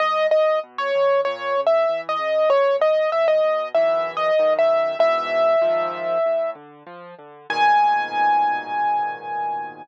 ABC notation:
X:1
M:4/4
L:1/16
Q:1/4=96
K:G#m
V:1 name="Acoustic Grand Piano"
d2 d2 z c3 (3c4 e4 d4 | c2 d2 e d3 (3e4 d4 e4 | e10 z6 | g16 |]
V:2 name="Acoustic Grand Piano" clef=bass
G,,2 A,,2 B,,2 D,2 A,,2 C,2 E,2 C,2 | F,,2 B,,2 C,2 B,,2 [B,,,F,,E,]4 [B,,,F,,D,]4 | [G,,B,,E,]4 [A,,,G,,D,^E,]4 =A,,2 =D,2 =F,2 D,2 | [G,,A,,B,,D,]16 |]